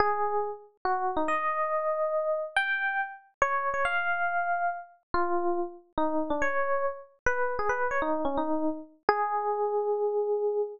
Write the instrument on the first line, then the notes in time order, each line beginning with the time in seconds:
electric piano 1
0.00 G#4
0.85 F#4
1.17 D#4
1.28 D#5
2.56 G5
3.42 C#5
3.74 C#5
3.85 F5
5.14 F4
5.98 D#4
6.30 D4
6.42 C#5
7.26 B4
7.59 G#4
7.69 B4
7.91 C#5
8.02 D#4
8.25 C#4
8.37 D#4
9.09 G#4